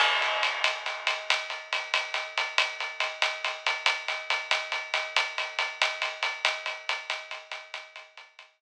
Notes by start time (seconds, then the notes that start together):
0.00 crash
0.22 closed hi-hat
0.43 closed hi-hat
0.64 closed hi-hat
0.86 closed hi-hat
1.07 closed hi-hat
1.30 closed hi-hat
1.50 closed hi-hat
1.73 closed hi-hat
1.94 closed hi-hat
2.14 closed hi-hat
2.38 closed hi-hat
2.58 closed hi-hat
2.80 closed hi-hat
3.00 closed hi-hat
3.22 closed hi-hat
3.44 closed hi-hat
3.66 closed hi-hat
3.86 closed hi-hat
4.08 closed hi-hat
4.30 closed hi-hat
4.51 closed hi-hat
4.72 closed hi-hat
4.94 closed hi-hat
5.16 closed hi-hat
5.38 closed hi-hat
5.59 closed hi-hat
5.82 closed hi-hat
6.02 closed hi-hat
6.23 closed hi-hat
6.45 closed hi-hat
6.66 closed hi-hat
6.89 closed hi-hat
7.10 closed hi-hat
7.31 closed hi-hat
7.52 closed hi-hat
7.74 closed hi-hat
7.96 closed hi-hat
8.17 closed hi-hat
8.39 closed hi-hat